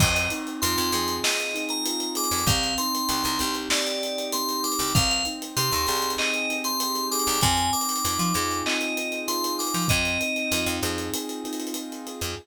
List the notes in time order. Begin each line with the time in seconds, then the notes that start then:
0.00 F2 C4 D#5, kick, crash
0.15 D#5, closed hi-hat
0.30 D#4, closed hi-hat
0.47 closed hi-hat
0.62 F2 F4 C6, closed hi-hat
0.78 F2, closed hi-hat
0.92 F2 G#4, closed hi-hat
1.08 closed hi-hat
1.24 C4 D#5, snare
1.40 snare, closed hi-hat
1.54 D#4, closed hi-hat
1.69 A#5, closed hi-hat
1.86 F4, closed hi-hat
2.00 closed hi-hat
2.15 G#4 D6, closed hi-hat
2.24 closed hi-hat
2.31 F2, closed hi-hat
2.38 closed hi-hat
2.47 C2 C4 F5, kick, closed hi-hat
2.63 snare, closed hi-hat
2.78 D#4 C6, closed hi-hat
2.95 closed hi-hat
3.09 C2 G4, closed hi-hat
3.24 C2, closed hi-hat
3.39 C2 C4, closed hi-hat
3.55 closed hi-hat
3.70 D#4 D5, snare
3.87 closed hi-hat
4.02 G4, closed hi-hat
4.18 closed hi-hat
4.32 C4 C6, closed hi-hat
4.49 closed hi-hat
4.64 D#4 D6, closed hi-hat
4.72 closed hi-hat
4.79 C2, closed hi-hat
4.88 closed hi-hat
4.95 C2 C4 F5, kick, closed hi-hat
5.10 F5, closed hi-hat
5.25 D#4, closed hi-hat
5.42 closed hi-hat
5.57 C3 G4 C6, closed hi-hat
5.72 D#2, closed hi-hat
5.87 C2 G#4, closed hi-hat
5.96 closed hi-hat
6.02 closed hi-hat
6.10 closed hi-hat
6.18 C4 D#5, clap
6.34 closed hi-hat
6.49 D#4, closed hi-hat
6.64 C6, closed hi-hat
6.80 G4, closed hi-hat
6.95 closed hi-hat
7.11 G#4 D6, closed hi-hat
7.19 closed hi-hat
7.27 C2, closed hi-hat
7.34 closed hi-hat
7.41 F2 C4 G#5, kick, closed hi-hat
7.57 closed hi-hat
7.73 D#4 D6, closed hi-hat
7.81 closed hi-hat
7.89 closed hi-hat
7.96 closed hi-hat
8.05 F2 F4, closed hi-hat
8.19 F3, closed hi-hat
8.34 F2 G#4, snare, closed hi-hat
8.51 closed hi-hat
8.66 C4 D#5, clap
8.81 closed hi-hat
8.97 D#4, closed hi-hat
9.12 closed hi-hat
9.28 F4 C6, closed hi-hat
9.44 closed hi-hat
9.59 G#4 D6, closed hi-hat
9.67 closed hi-hat
9.74 F3, closed hi-hat
9.82 closed hi-hat
9.88 F2 C4 D#5, kick, closed hi-hat
10.05 closed hi-hat
10.21 D#4, closed hi-hat
10.36 closed hi-hat
10.52 F2 F4, closed hi-hat
10.66 F2, closed hi-hat
10.81 F2 G#4, snare, closed hi-hat
10.98 closed hi-hat
11.14 C4, closed hi-hat
11.29 closed hi-hat
11.44 D#4, closed hi-hat
11.53 closed hi-hat
11.60 closed hi-hat
11.67 closed hi-hat
11.74 F4, closed hi-hat
11.92 closed hi-hat
12.07 G#4, closed hi-hat
12.21 F2, closed hi-hat